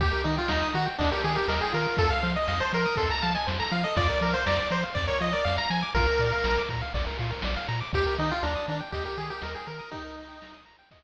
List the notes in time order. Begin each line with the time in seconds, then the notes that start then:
0.00 D#2 G4, kick, ride
0.12 A#4
0.24 D#3 D#4 D#5, ride
0.37 F4 G5
0.48 D#2 D#4 A#5, snare
0.62 D#6
0.73 D#3 F#4 A#5, ride
0.86 G5
0.98 D#2 D4 D#5, kick, ride
1.12 G4 A#4
1.23 D#3 G4 G#4, ride
1.35 G4 A#4
1.48 D#2 A#4 D#5, snare
1.61 G#4 G5
1.73 D#3 F4 A#4, ride
1.97 F2 A4, kick, ride
2.10 A4 F5
2.23 F3 C5, ride
2.36 D#5
2.48 F2 D#5 F5, snare
2.60 C5 A5
2.72 F3 A#4 C6, ride
2.85 D#6
2.96 F2 A4 C6, kick, ride
3.10 A5 A#5
3.22 F3 F5 A5, ride
3.35 D#5 G#5
3.47 F2 C5, snare
3.60 A4 A#5
3.71 F3 F4 F5, ride
3.84 A4 D#5
3.96 F2 F4 D5, kick, ride
4.09 A#4
4.21 F3 A#4 D5, ride
4.33 C5 F5
4.46 F2 D5 A#5, snare
4.58 D6
4.70 F3 C5 A#5, ride
4.83 F5
4.95 F2 D5, kick, ride
5.07 A#4 C#5
5.21 F3 F4 D#5, ride
5.33 A#4 D5
5.45 F2 D5 F5, snare
5.57 F5 A#5
5.70 F3 G#5 A#5, ride
5.82 D6
5.95 A#1 F4 A#4, kick, ride
6.08 A#4
6.19 A#2 D5, ride
6.32 F5
6.44 A#1 A#5, snare
6.58 D6
6.69 A#2 A#5, kick, ride
6.82 F5
6.94 A#1 D5, kick, ride
7.07 A#4
7.19 A#2 F4, ride
7.30 A#4
7.42 A#1 D5, snare
7.56 F5
7.68 A#2 A#5, ride
7.81 D6
7.93 D#2 G4, kick, ride
8.06 A#4
8.18 D#3 D#4 D#5, ride
8.30 F4 G5
8.43 D#2 D4 A#5, snare
8.55 D#6
8.67 D#3 D4 A#5, ride
8.80 G5
8.92 D#2 G4 D#5, kick, ride
9.05 G4 A#4
9.17 D#3 G4 G#4, ride
9.30 G4 A#4
9.42 D#2 A#4 D#5, snare
9.55 G#4 G5
9.66 D#3 A#4 A#5, ride
9.79 D#6
9.91 D#4 G4, kick, ride
10.05 A#4
10.17 D#5, ride
10.28 G5
10.41 A#5, snare
10.54 D#6
10.65 A#5, ride
10.79 G5
10.91 D#5, kick, ride